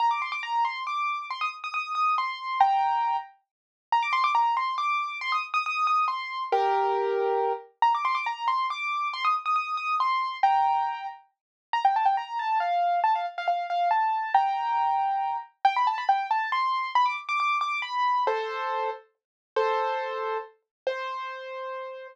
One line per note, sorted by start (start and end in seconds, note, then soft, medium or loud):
0.00 0.10 A#5 loud
0.11 0.21 D6 medium
0.22 0.32 C6 medium
0.32 0.42 D6 medium
0.43 0.64 A#5 medium
0.65 0.83 C6 medium
0.87 1.26 D6 medium
1.30 1.41 C6 medium
1.41 1.51 D#6 medium
1.64 1.73 D#6 medium
1.74 1.92 D#6 medium
1.95 2.15 D#6 medium
2.18 2.58 C6 medium
2.60 3.16 G5 medium
2.60 3.16 A#5 medium
3.92 4.03 A#5 loud
4.03 4.13 D6 loud
4.13 4.23 C6 loud
4.24 4.34 D6 loud
4.35 4.55 A#5 loud
4.57 4.75 C6 medium
4.78 5.17 D6 medium
5.21 5.32 C6 loud
5.32 5.42 D#6 medium
5.54 5.64 D#6 loud
5.66 5.87 D#6 loud
5.87 6.05 D#6 loud
6.08 6.43 C6 medium
6.52 7.53 G4 loud
6.52 7.53 A#4 loud
7.82 7.93 A#5 loud
7.95 8.05 D6 medium
8.05 8.15 C6 loud
8.15 8.25 D6 medium
8.26 8.48 A#5 medium
8.48 8.66 C6 medium
8.70 9.08 D6 medium
9.13 9.24 C6 loud
9.25 9.35 D#6 medium
9.46 9.55 D#6 medium
9.56 9.75 D#6 medium
9.77 9.95 D#6 medium
10.00 10.37 C6 medium
10.43 11.06 G5 medium
10.43 11.06 A#5 medium
11.73 11.84 A#5 loud
11.85 11.95 G5 medium
11.96 12.06 A5 medium
12.05 12.16 G5 medium
12.17 12.38 A#5 medium
12.39 12.59 A5 medium
12.60 13.00 F5 medium
13.04 13.14 A5 medium
13.15 13.26 F5 medium
13.38 13.47 F5 medium
13.48 13.67 F5 medium
13.70 13.89 F5 medium
13.91 14.32 A5 medium
14.34 15.37 G5 medium
14.34 15.37 A#5 medium
15.65 15.75 G5 loud
15.76 15.87 B5 medium
15.87 15.97 A5 loud
15.98 16.08 B5 medium
16.09 16.27 G5 medium
16.31 16.50 A5 medium
16.52 16.91 C6 medium
16.95 17.06 B5 loud
17.06 17.16 D6 loud
17.29 17.39 D6 loud
17.40 17.58 D6 loud
17.61 17.80 D6 loud
17.82 18.24 B5 medium
18.27 18.90 A4 medium
18.27 18.90 C5 loud
19.56 20.38 A4 medium
19.56 20.38 C5 loud
20.87 22.07 C5 loud